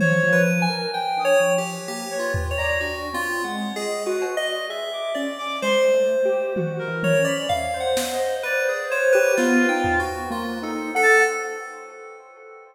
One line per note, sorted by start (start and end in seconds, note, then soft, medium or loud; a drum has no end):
0.00 0.21 F3 medium
0.00 0.29 C5 medium
0.00 0.42 C#5 loud
0.00 high tom loud
0.23 0.65 F3 loud
0.32 0.61 B4 medium
0.62 0.90 G#5 loud
0.70 0.91 A#4 medium
0.94 1.22 G5 loud
1.17 1.38 D4 medium
1.17 1.40 D#6 medium
1.25 1.53 C#5 loud
1.40 1.82 F3 medium
1.58 1.86 G4 medium
1.88 2.09 A#3 medium
1.88 2.16 G4 medium
2.11 2.53 B4 medium
2.11 2.32 C#5 medium
2.19 2.47 F4 medium
2.34 floor tom loud
2.51 2.79 C#5 medium
2.57 2.80 D5 loud
2.57 2.78 A#5 medium
2.81 3.09 D4 soft
2.81 3.09 F#4 medium
3.13 3.42 C4 medium
3.13 3.42 F4 loud
3.44 3.72 G#3 medium
3.44 3.72 F#5 soft
3.76 4.04 G#4 medium
3.76 4.04 D#5 loud
4.06 4.35 F#4 loud
4.06 4.34 B4 medium
4.22 cowbell medium
4.37 4.65 D5 medium
4.37 4.65 D#5 loud
4.69 4.90 G#4 medium
4.69 5.12 E5 medium
4.93 5.35 D6 medium
5.14 5.58 C#4 medium
5.14 5.57 D5 medium
5.38 5.59 D6 loud
5.62 5.90 G#3 medium
5.62 6.89 C5 medium
5.62 5.83 C6 loud
5.94 6.22 A3 medium
6.25 6.53 G4 loud
6.56 6.85 F#4 medium
6.56 high tom medium
6.79 7.21 A#4 medium
6.88 7.16 E3 medium
7.03 7.25 C#5 loud
7.03 high tom medium
7.19 7.47 C#4 medium
7.25 7.46 D5 loud
7.25 7.47 B5 medium
7.49 7.71 E5 medium
7.49 7.77 F5 loud
7.49 floor tom medium
7.74 9.00 C5 loud
7.80 8.08 F#5 medium
7.97 snare medium
8.14 8.42 D#5 medium
8.43 8.64 B4 loud
8.43 8.86 D5 medium
8.69 8.90 G#4 soft
8.89 9.12 C5 loud
8.89 9.32 C#5 medium
9.12 9.36 G4 loud
9.12 9.34 B4 loud
9.36 9.66 B3 loud
9.36 9.99 F4 loud
9.36 9.67 B4 medium
9.36 snare medium
9.69 9.97 D#4 medium
9.69 9.97 G5 medium
9.84 floor tom medium
10.00 10.29 B3 medium
10.00 10.28 F#4 medium
10.30 10.58 A#3 loud
10.30 10.60 F4 medium
10.62 10.90 D#4 loud
10.62 10.91 A4 medium
10.95 11.24 A4 loud
10.95 11.23 F#5 loud
11.02 11.23 A5 loud